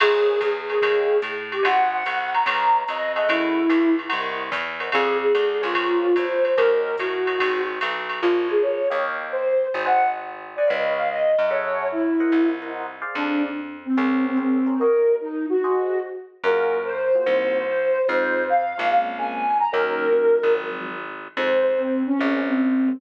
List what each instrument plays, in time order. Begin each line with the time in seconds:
0.00 electric bass (finger) A#1, flute G#4, electric piano 1 A#4 C5 C#5 G#5, crash, ride
0.41 electric bass (finger) E2, kick, hi-hat pedal, ride
0.70 flute G#4, electric piano 1 A#4 C5 C#5 G#5, ride
0.82 electric bass (finger) D#2, electric piano 1 C#5 D#5 F5 G5, kick, ride
1.22 electric bass (finger) A2, hi-hat pedal, ride
1.52 flute G4, ride
1.63 electric bass (finger) G#1, electric piano 1 C5 D#5 F#5 G#5, flute F#5, ride
1.92 flute F#5
2.06 electric bass (finger) C2, hi-hat pedal, ride
2.34 flute A#5, ride
2.46 electric bass (finger) C#2, electric piano 1 B4 C#5 D#5 F5, ride
2.88 electric bass (finger) F2, flute D#5, hi-hat pedal, ride
3.16 electric piano 1 G#4 A4 E5 F#5, flute D#5, ride
3.29 electric bass (finger) F#2, flute E4, ride
3.69 electric bass (finger) C#2, hi-hat pedal, ride
3.99 ride
4.09 electric bass (finger) C2, electric piano 1 A#4 C5 D#5 F#5, ride
4.52 electric bass (finger) E2, kick, hi-hat pedal, ride
4.80 electric piano 1 A#4 C5 D#5 F#5, ride
4.92 electric bass (finger) F2, flute G#4, electric piano 1 G#4 C5 D5 F5, kick, ride
5.22 flute G#4
5.35 electric bass (finger) D2, hi-hat pedal, ride
5.62 electric bass (finger) C#2, flute F4, electric piano 1 G#4 A#4 C5 C#5, ride
5.75 kick, ride
6.16 electric bass (finger) E2, flute C5, kick, hi-hat pedal, ride
6.44 flute C5, ride
6.57 electric bass (finger) D#2, electric piano 1 F#4 A#4 C#5 D#5, flute A#4, kick, ride
6.98 electric bass (finger) A2, flute F#4, kick, hi-hat pedal, ride
7.27 electric piano 1 F#4 A#4 C#5 D#5, ride
7.38 electric bass (finger) G#1, electric piano 1 F#4 G#4 C5 D#5, kick, ride
7.81 electric bass (finger) B1, hi-hat pedal, ride
8.09 ride
8.22 electric bass (finger) A#1, flute F4, electric piano 1 A#4 C5 C#5 G#5
8.49 flute G#4, electric piano 1 A#4 C5 C#5 G#5
8.62 flute C#5
8.90 electric bass (finger) D#2, electric piano 1 C#5 D#5 F5 G5
9.32 flute C5
9.74 electric bass (finger) G#1, flute C5
9.86 electric piano 1 C5 D#5 F#5 G#5, flute F#5
10.56 electric piano 1 C5 D#5 F#5 G#5, flute D5
10.67 electric bass (finger) C#2, electric piano 1 B4 C#5 D#5 F5, flute D#5
10.97 flute F5
11.10 flute D#5
11.39 electric bass (finger) F#2
11.50 electric piano 1 G#4 A4 E5 F#5, flute C#5
11.92 flute E4
12.20 electric piano 1 A#4 C5 D#5 F#5
12.32 electric bass (finger) C2
12.62 electric piano 1 A#4 C5 D#5 F#5
13.02 electric piano 1 G#4 C5 D5 F5
13.15 electric bass (finger) F2, flute D4
13.85 flute C4
13.97 electric bass (finger) C#2, flute C4, electric piano 1 G#4 A#4 C5 C#5
14.25 flute C4
14.37 flute C4, electric piano 1 G#4 A#4 C5 C#5
14.66 electric piano 1 G#4 A#4 C5 C#5
14.79 electric piano 1 F#4 A#4 C#5 D#5, flute A#4
15.21 flute D#4
15.49 flute F#4
15.64 electric piano 1 F#4 G#4 C5 D#5
16.43 electric bass (finger) F#2, electric piano 1 A#3 F4 F#4 G#4, flute A#4
16.85 flute C5
17.15 electric piano 1 A#3 F4 F#4 G#4
17.26 electric bass (finger) C2, electric piano 1 A#3 C4 D#4 F#4
17.67 flute C5
18.08 electric bass (finger) F2, electric piano 1 G#3 C4 D#4 F4, flute C5
18.49 flute F5
18.78 electric bass (finger) A#1, electric piano 1 G#3 C4 D#4 F4
18.90 electric piano 1 G#3 A#3 C4 C#4, flute F5
19.18 electric piano 1 G#3 A#3 C4 C#4, flute G#5
19.60 flute A#5
19.72 electric bass (finger) D#2, electric piano 1 F#3 A#3 C#4 D#4, flute A#4
20.12 electric piano 1 F#3 A#3 C#4 D#4
20.43 electric bass (finger) G#1
20.55 electric piano 1 F3 F#3 G#3 C4
21.37 electric bass (finger) F2, electric piano 1 D#3 F3 G#3 C4, flute C5
21.67 flute C5
21.78 flute C4
22.07 flute C#4
22.19 electric bass (finger) A#1, electric piano 1 G#3 A#3 C4 C#4
22.48 flute C4
22.88 electric piano 1 G#3 A#3 C4 C#4